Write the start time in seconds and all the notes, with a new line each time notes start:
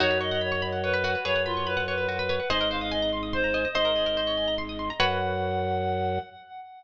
0.00 F#2 D#4 F#4 C#5
0.11 B4
0.21 C#5 D#5
0.31 D#5 F#5
0.41 C#5 B5
0.52 C#6
0.62 B5
0.72 F#5
0.83 B4 C#5
0.94 B4
1.04 F#4
1.15 B4
1.25 F#2 G#4 B4 C#5
1.36 F#5
1.46 F4 B5
1.57 C#6
1.67 B4 B5
1.77 F#5
1.88 B4 C#5
1.98 B4
2.09 F#4
2.19 B4
2.29 B4 C#5
2.40 F#5
2.50 G#1 G#4 C5 D#5
2.61 A#4
2.71 C5 F5
2.81 D#5 F5
2.91 D#5 G#5
3.02 A#5
3.13 C6
3.23 D#6
3.33 C5 C6
3.44 A#5
3.54 D#5 G#5
3.65 D#5
3.75 G#1 C5 D#5
3.85 A#4
3.96 G#4
4.06 A#4
4.17 C5
4.27 C#5
4.37 G#5
4.48 A#5
4.58 C6
4.69 D#6
4.79 C6
4.90 A#5
5.00 F#2 F#4 B4 C#5 F#5